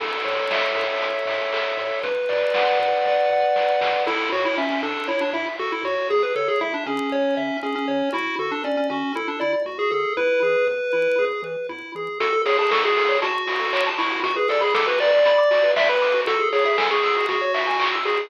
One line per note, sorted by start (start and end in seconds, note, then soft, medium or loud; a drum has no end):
0.00 0.14 A1 medium
0.00 0.76 A4 medium
0.00 kick medium
0.00 crash medium
0.25 0.40 A2 medium
0.25 1.02 C#5 medium
0.25 open hi-hat medium
0.50 0.64 A1 medium
0.50 1.26 E5 medium
0.50 kick medium
0.50 snare loud
0.75 0.89 A2 medium
0.75 1.53 A4 medium
0.75 open hi-hat medium
1.01 1.15 A1 medium
1.01 1.78 C#5 medium
1.01 kick medium
1.01 closed hi-hat loud
1.26 1.40 A2 medium
1.26 1.99 E5 medium
1.26 open hi-hat medium
1.52 1.66 A1 soft
1.52 2.02 A4 medium
1.52 kick medium
1.52 clap loud
1.77 1.91 A2 medium
1.77 2.03 C#5 medium
1.77 open hi-hat medium
2.03 2.17 B1 medium
2.03 2.79 B4 medium
2.03 kick loud
2.03 closed hi-hat medium
2.29 2.44 B2 medium
2.29 3.05 D5 medium
2.29 open hi-hat medium
2.54 2.69 B1 medium
2.54 3.30 F#5 medium
2.54 kick medium
2.54 snare loud
2.79 2.93 B2 medium
2.79 3.55 B4 medium
2.79 open hi-hat medium
3.05 3.20 B1 medium
3.05 3.81 D5 medium
3.05 kick medium
3.05 snare medium
3.30 3.44 B2 medium
3.30 4.03 F#5 medium
3.56 3.70 B1 medium
3.56 4.04 B4 medium
3.56 snare medium
3.81 3.95 B2 medium
3.81 4.05 D5 soft
3.81 snare loud
4.06 4.21 A1 medium
4.06 4.29 E4 medium
4.06 4.29 A4 medium
4.06 kick loud
4.06 crash medium
4.32 4.47 A2 medium
4.32 4.44 F#4 medium
4.32 4.55 C#5 medium
4.45 4.57 E4 medium
4.56 4.70 A1 medium
4.56 4.70 C#4 medium
4.56 4.81 E5 medium
4.56 kick medium
4.70 4.82 C#4 medium
4.83 4.97 A2 medium
4.83 5.08 D4 medium
4.83 5.06 A4 medium
5.08 5.22 A1 medium
5.08 5.21 E4 medium
5.08 5.31 C#5 medium
5.08 kick medium
5.21 5.33 D4 medium
5.33 5.47 A2 medium
5.33 5.46 E4 medium
5.33 5.56 E5 medium
5.59 5.73 A1 medium
5.59 5.71 F#4 medium
5.59 5.82 A4 medium
5.59 kick medium
5.72 5.84 E4 medium
5.83 5.97 A2 medium
5.83 6.09 F#4 medium
5.83 6.08 C#5 medium
6.10 6.24 C#2 medium
6.10 6.33 G#4 medium
6.10 6.23 G#4 medium
6.10 kick loud
6.23 6.35 B4 medium
6.35 6.49 C#3 medium
6.35 6.48 A4 medium
6.35 6.59 C#5 medium
6.48 6.60 G#4 medium
6.61 6.76 C#2 medium
6.61 6.73 E4 medium
6.61 6.84 E5 medium
6.61 kick medium
6.74 6.86 D4 medium
6.86 7.00 C#3 medium
6.86 7.57 C#4 medium
6.86 7.10 G#4 medium
7.12 7.26 C#2 medium
7.12 7.35 C#5 medium
7.12 kick medium
7.37 7.51 C#3 medium
7.37 7.60 E5 medium
7.63 7.76 C#2 medium
7.63 7.75 C#4 medium
7.63 7.86 G#4 medium
7.63 kick medium
7.75 8.09 C#4 medium
7.88 8.03 C#3 medium
7.88 8.11 C#5 medium
8.13 8.28 D2 medium
8.13 8.36 E4 medium
8.13 8.35 F#4 medium
8.13 kick loud
8.38 8.52 D3 medium
8.38 8.51 F#4 medium
8.38 8.62 A4 medium
8.51 8.64 D4 medium
8.64 8.80 D2 medium
8.64 8.76 C#4 medium
8.64 8.87 D5 medium
8.64 kick medium
8.77 8.89 C#4 medium
8.90 9.04 D3 medium
8.90 9.13 C#4 medium
8.90 9.14 F#4 medium
9.15 9.29 D2 medium
9.15 9.27 E4 medium
9.15 9.39 A4 medium
9.15 kick medium
9.28 9.40 D4 medium
9.40 9.56 D3 medium
9.40 9.53 E4 medium
9.40 9.63 D5 medium
9.65 9.79 D2 medium
9.65 9.89 F#4 medium
9.65 9.78 F#4 medium
9.65 kick medium
9.79 9.91 G#4 medium
9.91 10.06 D3 medium
9.91 10.13 G#4 medium
9.91 10.14 A4 medium
10.17 10.31 E2 medium
10.17 10.40 E4 medium
10.17 11.25 B4 medium
10.17 kick medium
10.42 10.56 E3 medium
10.42 10.65 G#4 medium
10.67 10.81 E2 medium
10.67 10.90 B4 medium
10.67 kick medium
10.93 11.08 E3 soft
10.93 11.16 E4 medium
11.19 11.33 E2 medium
11.19 11.42 G#4 medium
11.19 kick medium
11.42 11.56 E3 medium
11.42 11.67 B4 medium
11.69 11.83 E2 medium
11.69 11.92 E4 medium
11.69 kick medium
11.95 12.09 E3 medium
11.95 12.19 G#4 medium
12.20 12.32 F#4 medium
12.20 12.42 A4 medium
12.20 kick loud
12.20 closed hi-hat loud
12.33 12.44 A4 medium
12.45 12.58 G#4 medium
12.45 12.58 C#5 medium
12.45 open hi-hat medium
12.59 12.71 G#4 medium
12.59 12.70 A5 medium
12.71 12.83 A4 medium
12.71 12.83 C#6 medium
12.71 kick medium
12.71 snare loud
12.84 12.96 F#4 medium
12.84 13.18 G#4 medium
12.97 13.08 A4 medium
12.97 open hi-hat medium
13.09 13.20 C#5 medium
13.22 13.89 F#4 medium
13.22 13.33 A5 medium
13.22 kick medium
13.22 closed hi-hat loud
13.35 13.46 C#6 medium
13.47 13.58 F#4 medium
13.47 open hi-hat medium
13.60 13.71 A4 medium
13.73 13.84 C#5 medium
13.73 kick medium
13.73 clap loud
13.87 13.98 A5 medium
13.98 14.20 E4 medium
13.98 14.09 C#6 medium
13.98 open hi-hat medium
14.12 14.23 F#4 medium
14.23 14.35 F#4 medium
14.23 14.36 F#4 medium
14.23 kick loud
14.23 closed hi-hat loud
14.36 14.49 G#4 medium
14.36 14.47 B4 medium
14.49 14.61 A4 medium
14.49 14.61 D5 medium
14.49 open hi-hat medium
14.61 14.74 G#4 medium
14.61 14.72 B5 medium
14.75 14.87 A4 medium
14.75 14.86 D6 medium
14.75 kick loud
14.75 snare loud
14.87 14.98 F#4 medium
14.87 14.99 B4 medium
15.00 15.11 B4 medium
15.00 15.72 D5 medium
15.00 open hi-hat medium
15.13 15.24 D5 medium
15.25 15.37 B5 medium
15.25 kick medium
15.25 closed hi-hat loud
15.38 15.50 D6 medium
15.51 15.62 F#4 medium
15.51 open hi-hat medium
15.63 15.75 B4 medium
15.76 15.88 D5 medium
15.76 15.88 E5 medium
15.76 kick loud
15.76 snare loud
15.89 16.21 B4 medium
15.89 16.01 B5 medium
16.02 16.13 D6 medium
16.02 open hi-hat medium
16.14 16.25 F#4 medium
16.27 16.38 F#4 medium
16.27 16.49 A4 medium
16.27 kick loud
16.27 closed hi-hat loud
16.40 16.51 G#4 medium
16.53 16.65 G#4 medium
16.53 16.64 C#5 medium
16.53 open hi-hat medium
16.65 16.77 G#4 medium
16.65 16.77 E5 medium
16.78 16.90 A4 medium
16.78 16.89 G#5 medium
16.78 kick medium
16.78 snare loud
16.91 17.26 G#4 medium
16.91 17.02 C#6 medium
17.03 17.15 E6 medium
17.03 open hi-hat medium
17.16 17.28 F#4 medium
17.29 17.96 F#4 medium
17.29 17.41 G#4 medium
17.29 kick loud
17.29 closed hi-hat loud
17.41 17.53 C#5 medium
17.54 17.66 E5 medium
17.54 open hi-hat medium
17.67 17.79 G#5 medium
17.80 17.92 C#6 medium
17.80 kick medium
17.80 clap loud
17.93 18.04 E6 medium
18.05 18.17 F#4 medium
18.05 18.26 G#4 medium
18.05 open hi-hat medium
18.17 18.28 G#4 medium